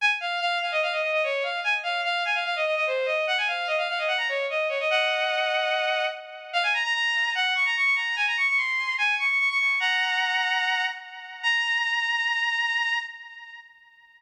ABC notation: X:1
M:4/4
L:1/16
Q:1/4=147
K:Db
V:1 name="Violin"
a z f2 f2 f e f e e e d2 f2 | a z f2 f2 a f f e e e c2 e2 | g a f2 e f f e g b d2 e2 d e | [eg]12 z4 |
[K:Bbm] f a b b b4 g2 d' b d' d' b2 | a b d' d' c'4 a2 d' d' d' d' d'2 | [gb]12 z4 | b16 |]